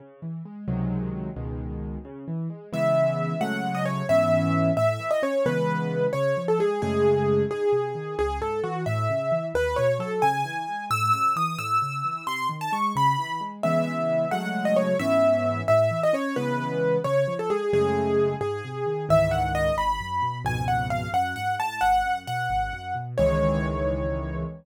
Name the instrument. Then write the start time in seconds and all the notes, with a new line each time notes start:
acoustic grand piano
0.00 C#3
0.22 E3
0.45 G#3
0.68 C#2 C3 D#3 F#3 G#3
1.36 C#2 B2 D#3 G#3
2.05 C#3
2.28 E3
2.50 G#3
2.73 C#3 E3 G#3 B3 E5
3.41 C#3 F#3 G#3 A3 F#5
3.75 D#5
3.85 C#5
4.09 G#2 E3 B3 C#4 E5
4.77 A2 E5
5.00 E3
5.11 D#5
5.22 C#4 C#5
5.46 C#3 E3 G#3 B3 B4
6.13 C#3 C#5
6.37 F3
6.48 A4
6.59 G#3 G#4
6.82 F#2 C#3 G#3 A3 G#4
7.51 G#2 G#4
7.73 C3
7.95 D#3
8.19 C#2 G#4
8.41 G#2 A4
8.63 E3 F#4
8.86 A2 E5
9.10 C#3
9.32 E3
9.54 D#2 B4
9.76 B2 C#5
9.99 F#3 A4
10.22 C#3 G#5
10.45 E3
10.68 G#3
10.90 A2 E6
11.13 C#3 E6
11.36 E3 D#6
11.58 A2 E6
11.82 C#3
12.04 E3
12.27 C3 C6
12.49 D#3
12.61 A5
12.72 G#3 C#6
12.96 C#3 B5
13.19 E3
13.41 G#3
13.63 C#3 E3 G#3 B3 E5
14.31 C#3 F#3 G#3 A3 F#5
14.65 D#5
14.76 C#5
14.99 G#2 E3 B3 C#4 E5
15.68 A2 E5
15.91 E3
16.03 D#5
16.13 C#4 C#5
16.36 C#3 E3 G#3 B3 B4
17.04 C#3 C#5
17.28 F3
17.39 A4
17.50 G#3 G#4
17.73 F#2 C#3 G#3 A3 G#4
18.41 G#2 G#4
18.64 C3
18.86 D#3
19.09 C#2 G#2 D#3 E3 E5
19.31 F#5
19.55 D#5
19.77 G#1 B5
20.00 F#2
20.22 B2
20.45 C#2 F2 G#2 B2 G#5
20.68 F#5
20.90 F5
21.14 F#2 F#5
21.36 G#2 F#5
21.59 A2 A5
21.81 G#1 F#5
22.05 F#2
22.27 B2 F#5
22.50 G#1
22.73 F#2
22.95 B2
23.18 C#2 D#3 E3 G#3 C#5